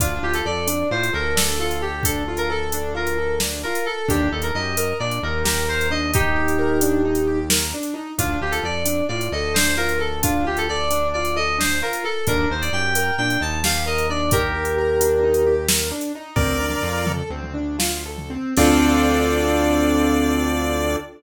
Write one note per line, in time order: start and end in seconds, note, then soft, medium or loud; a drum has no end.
0.00 0.19 D2 medium
0.00 0.21 D4 medium
0.00 0.22 F4 medium
0.00 kick loud
0.00 closed hi-hat loud
0.23 0.42 D2 medium
0.23 0.44 F4 medium
0.23 0.34 G4 medium
0.34 0.45 A4 medium
0.34 closed hi-hat medium
0.45 0.84 F2 medium
0.45 0.66 A4 medium
0.45 0.90 D5 medium
0.67 0.88 D4 medium
0.67 closed hi-hat loud
0.91 1.10 A2 medium
0.91 1.11 F4 medium
0.91 1.11 C5 medium
1.03 closed hi-hat medium
1.13 3.65 D2 medium
1.13 1.34 A4 medium
1.13 1.34 A#4 medium
1.36 1.56 D4 medium
1.36 1.58 A4 medium
1.36 snare loud
1.60 1.80 F4 medium
1.60 1.81 A4 medium
1.71 closed hi-hat medium
1.81 2.04 G4 medium
1.81 2.02 A4 medium
2.03 2.23 D4 medium
2.03 2.34 A4 medium
2.03 kick loud
2.03 closed hi-hat loud
2.28 2.48 F4 medium
2.37 2.48 A#4 medium
2.37 closed hi-hat medium
2.50 2.70 A4 medium
2.50 2.88 A4 medium
2.72 2.94 D4 medium
2.72 closed hi-hat loud
2.95 3.15 F4 medium
2.95 3.35 A#4 medium
3.07 closed hi-hat medium
3.18 3.38 A4 medium
3.40 3.62 D4 medium
3.40 snare loud
3.63 3.85 F4 medium
3.63 3.85 A#4 medium
3.75 closed hi-hat medium
3.86 4.05 A4 medium
3.86 4.08 A4 medium
4.08 4.29 D#2 medium
4.08 4.29 D4 medium
4.08 4.28 G4 medium
4.08 kick loud
4.08 closed hi-hat loud
4.31 4.51 D#2 medium
4.31 4.51 D#4 medium
4.31 4.43 A4 medium
4.42 4.54 A#4 medium
4.42 closed hi-hat medium
4.54 4.93 F#2 medium
4.54 4.76 G4 medium
4.54 4.93 D#5 medium
4.77 4.98 A#4 medium
4.77 closed hi-hat loud
4.99 5.19 A#2 medium
4.99 5.21 D4 medium
4.99 5.19 D5 medium
5.11 closed hi-hat medium
5.22 7.74 D#2 medium
5.22 5.43 D#4 medium
5.22 5.42 A#4 medium
5.44 5.65 G4 medium
5.44 5.66 A#4 medium
5.44 snare loud
5.67 5.87 A#4 medium
5.67 5.90 C5 medium
5.81 closed hi-hat medium
5.90 6.11 D4 medium
5.90 6.10 D#5 medium
6.14 7.39 D#4 medium
6.14 6.35 D#4 medium
6.14 7.39 G4 medium
6.14 kick loud
6.14 closed hi-hat loud
6.36 6.56 G4 medium
6.48 closed hi-hat medium
6.58 6.79 A#4 medium
6.81 7.02 D4 medium
6.81 closed hi-hat loud
7.05 7.25 D#4 medium
7.15 closed hi-hat medium
7.27 7.48 G4 medium
7.50 7.70 A#4 medium
7.50 snare loud
7.74 7.94 D4 medium
7.83 closed hi-hat medium
7.94 8.14 D#4 medium
8.18 8.38 D2 medium
8.18 8.39 D4 medium
8.18 8.39 F4 medium
8.18 kick loud
8.18 closed hi-hat loud
8.41 8.60 D2 medium
8.41 8.63 F4 medium
8.41 8.52 G4 medium
8.51 8.62 A4 medium
8.51 closed hi-hat medium
8.63 9.02 F2 medium
8.63 8.83 A4 medium
8.63 9.04 D5 medium
8.85 9.05 D4 medium
8.85 closed hi-hat loud
9.08 9.29 A2 medium
9.08 9.30 F4 medium
9.08 9.27 D5 medium
9.21 closed hi-hat medium
9.32 11.83 D2 medium
9.32 9.53 A4 medium
9.32 9.53 D#5 medium
9.54 9.76 D4 medium
9.54 9.74 C5 medium
9.54 snare loud
9.77 9.98 F4 medium
9.77 9.98 A#4 medium
9.89 closed hi-hat medium
9.99 10.19 A4 medium
9.99 10.20 A4 medium
10.23 10.43 D4 medium
10.23 10.45 F4 medium
10.23 kick loud
10.23 closed hi-hat loud
10.45 10.65 F4 medium
10.45 10.57 G4 medium
10.57 10.68 A4 medium
10.57 closed hi-hat medium
10.69 10.89 A4 medium
10.69 11.07 D5 medium
10.91 11.11 D4 medium
10.91 closed hi-hat loud
11.14 11.36 F4 medium
11.14 11.34 D5 medium
11.25 closed hi-hat medium
11.36 11.57 A4 medium
11.36 11.57 D#5 medium
11.58 11.79 D4 medium
11.58 11.79 C5 medium
11.58 snare loud
11.82 12.03 F4 medium
11.82 12.03 A#4 medium
11.93 closed hi-hat medium
12.04 12.25 A4 medium
12.04 12.24 A4 medium
12.27 12.46 D#2 medium
12.27 12.48 D4 medium
12.27 12.47 A#4 medium
12.27 kick loud
12.27 closed hi-hat loud
12.49 12.70 D#2 medium
12.49 12.70 D#4 medium
12.49 12.62 C5 medium
12.61 12.72 D5 medium
12.61 closed hi-hat medium
12.73 13.11 F#2 medium
12.73 12.94 G4 medium
12.73 13.14 G5 medium
12.95 13.16 A#4 medium
12.95 closed hi-hat loud
13.18 13.37 A#2 medium
13.18 13.40 D4 medium
13.18 13.40 G5 medium
13.30 closed hi-hat medium
13.40 15.92 D#2 medium
13.40 13.60 D#4 medium
13.40 13.60 A5 medium
13.64 13.85 G4 medium
13.64 13.83 F5 medium
13.64 snare loud
13.86 14.06 A#4 medium
13.86 14.06 D#5 medium
13.98 closed hi-hat medium
14.10 14.30 D4 medium
14.10 14.30 D5 medium
14.31 14.52 D#4 medium
14.31 15.54 G4 medium
14.31 15.54 A#4 medium
14.31 kick loud
14.31 closed hi-hat loud
14.54 14.75 G4 medium
14.65 closed hi-hat medium
14.78 14.99 A#4 medium
15.00 15.21 D4 medium
15.00 closed hi-hat loud
15.23 15.43 D#4 medium
15.34 closed hi-hat medium
15.46 15.67 G4 medium
15.68 15.89 A#4 medium
15.68 snare loud
15.91 16.12 D4 medium
16.01 closed hi-hat medium
16.15 16.36 D#4 medium
16.36 16.75 D2 medium
16.36 16.57 C4 medium
16.36 17.12 A#4 medium
16.36 17.12 D5 medium
16.36 kick loud
16.36 floor tom loud
16.60 16.81 D4 medium
16.70 floor tom medium
16.82 17.23 F2 medium
16.82 17.04 F4 medium
17.06 17.28 A4 medium
17.06 floor tom loud
17.30 18.37 D2 medium
17.30 17.53 C4 medium
17.43 floor tom medium
17.54 17.76 D4 medium
17.79 18.02 F4 medium
17.79 snare loud
18.06 18.29 A4 medium
18.18 floor tom medium
18.30 18.54 C4 medium
18.57 20.96 D2 loud
18.57 20.96 C4 loud
18.57 20.96 D4 loud
18.57 20.96 F4 loud
18.57 20.96 A4 medium
18.57 20.96 D5 loud
18.57 kick loud
18.57 crash loud